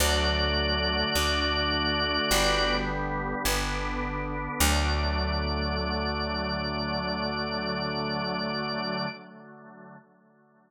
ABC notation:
X:1
M:4/4
L:1/8
Q:1/4=52
K:D
V:1 name="Drawbar Organ"
[Fd]5 z3 | d8 |]
V:2 name="Drawbar Organ"
[D,F,A,]2 [D,A,D]2 [D,G,B,]2 [D,B,D]2 | [D,F,A,]8 |]
V:3 name="Electric Bass (finger)" clef=bass
D,,2 D,,2 G,,,2 G,,,2 | D,,8 |]